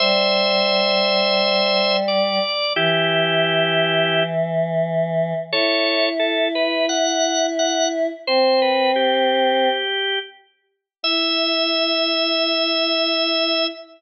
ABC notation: X:1
M:4/4
L:1/8
Q:1/4=87
K:Em
V:1 name="Drawbar Organ"
[ce]6 d2 | [EG]5 z3 | [A^c]2 A B f2 f z | c B G4 z2 |
e8 |]
V:2 name="Choir Aahs"
G,8 | E,8 | E8 | C5 z3 |
E8 |]